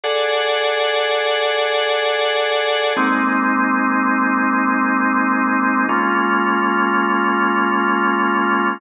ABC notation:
X:1
M:4/4
L:1/8
Q:1/4=82
K:Abmix
V:1 name="Drawbar Organ"
[A=A=d^f]8 | [A,B,CE]8 | [A,B,DF]8 |]